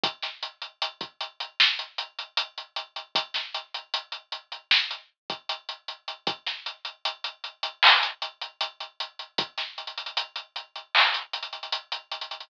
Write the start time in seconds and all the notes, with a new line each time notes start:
0.03 kick, closed hi-hat
0.22 snare, closed hi-hat
0.43 closed hi-hat
0.62 closed hi-hat
0.82 closed hi-hat
1.01 kick, closed hi-hat
1.20 closed hi-hat
1.40 closed hi-hat
1.60 snare
1.79 closed hi-hat
1.98 closed hi-hat
2.19 closed hi-hat
2.37 closed hi-hat
2.57 closed hi-hat
2.76 closed hi-hat
2.96 closed hi-hat
3.15 kick, closed hi-hat
3.34 snare, closed hi-hat
3.54 closed hi-hat
3.74 closed hi-hat
3.94 closed hi-hat
4.12 closed hi-hat
4.32 closed hi-hat
4.52 closed hi-hat
4.71 snare
4.91 closed hi-hat
5.30 kick, closed hi-hat
5.49 closed hi-hat
5.69 closed hi-hat
5.88 closed hi-hat
6.08 closed hi-hat
6.27 kick, closed hi-hat
6.46 snare, closed hi-hat
6.66 closed hi-hat
6.85 closed hi-hat
7.05 closed hi-hat
7.24 closed hi-hat
7.44 closed hi-hat
7.63 closed hi-hat
7.83 clap
8.03 closed hi-hat
8.22 closed hi-hat
8.41 closed hi-hat
8.61 closed hi-hat
8.80 closed hi-hat
9.00 closed hi-hat
9.19 closed hi-hat
9.38 kick, closed hi-hat
9.57 snare, closed hi-hat
9.78 closed hi-hat
9.87 closed hi-hat
9.97 closed hi-hat
10.06 closed hi-hat
10.17 closed hi-hat
10.36 closed hi-hat
10.56 closed hi-hat
10.75 closed hi-hat
10.95 clap
11.14 closed hi-hat
11.33 closed hi-hat
11.43 closed hi-hat
11.53 closed hi-hat
11.63 closed hi-hat
11.72 closed hi-hat
11.92 closed hi-hat
12.11 closed hi-hat
12.21 closed hi-hat
12.31 closed hi-hat
12.40 closed hi-hat